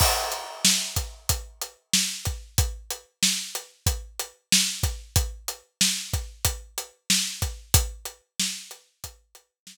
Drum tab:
CC |x-------|--------|--------|--------|
HH |-x-xxx-x|xx-xxx-x|xx-xxx-x|xx-xxx--|
SD |--o---o-|--o---o-|--o---o-|--o---o-|
BD |o--oo--o|o---o--o|o--oo--o|o---o---|